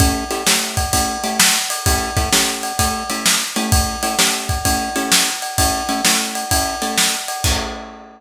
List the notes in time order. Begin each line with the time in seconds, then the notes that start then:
0.00 A3 C#4 E4 G4, kick, ride
0.31 A3 C#4 E4 G4, ride
0.47 A3 C#4 E4 G4, snare
0.77 kick, ride
0.93 A3 C#4 E4 G4, kick, ride
1.24 A3 C#4 E4 G4, ride
1.40 snare
1.70 ride
1.86 A3 C#4 E4 G4, kick, ride
2.17 A3 C#4 E4 G4, kick, ride
2.32 A3 C#4 E4 G4, snare
2.63 ride
2.79 A3 C#4 E4 G4, kick, ride
3.10 A3 C#4 E4 G4, ride
3.26 snare
3.56 A3 C#4 E4 G4, ride
3.72 kick, ride
4.03 A3 C#4 E4 G4, ride
4.19 A3 C#4 E4 G4, snare
4.49 kick, ride
4.65 A3 C#4 E4 G4, kick, ride
4.96 A3 C#4 E4 G4, ride
5.12 snare
5.42 ride
5.58 A3 C#4 E4 G4, kick, ride
5.89 A3 C#4 E4 G4, ride
6.05 A3 C#4 E4 G4, snare
6.35 ride
6.51 A3 C#4 E4 G4, kick, ride
6.82 A3 C#4 E4 G4, ride
6.98 snare
7.28 ride
7.44 A3 C#4 E4 G4, kick, crash